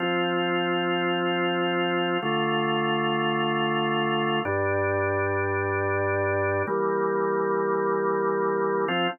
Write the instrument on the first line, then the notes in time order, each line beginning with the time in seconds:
drawbar organ
0.00 F3 C4 F4
2.22 D3 A3 F4
4.45 G2 G3 D4
6.67 E3 G3 A#3
8.88 F3 C4 F4